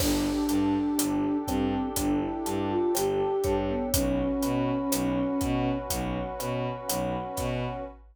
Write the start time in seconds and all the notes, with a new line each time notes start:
0.00 G1 D4 G4 A4 D5, kick, cross-stick, crash
0.49 G2 A5, closed hi-hat
0.98 G1 D5, closed hi-hat
1.48 G2 C4 G5, kick, cross-stick, closed hi-hat
1.96 G1 D4 D5, kick, closed hi-hat
2.21 E4
2.46 G2 A5, closed hi-hat
2.70 F4
2.94 G1 G4 G5, cross-stick, closed hi-hat
3.44 G2 C#5, kick, closed hi-hat
3.69 B3
3.94 B1 C#4 F#4 B4, kick, closed hi-hat
4.42 B2 B5, closed hi-hat
4.92 B1 C#5, cross-stick, closed hi-hat
5.41 B2 F#5, kick, closed hi-hat
5.90 B1 C#5, kick, closed hi-hat
6.39 B2 B5, cross-stick, closed hi-hat
6.89 B1 F#5, closed hi-hat
7.37 B2 C#5, kick, snare, closed hi-hat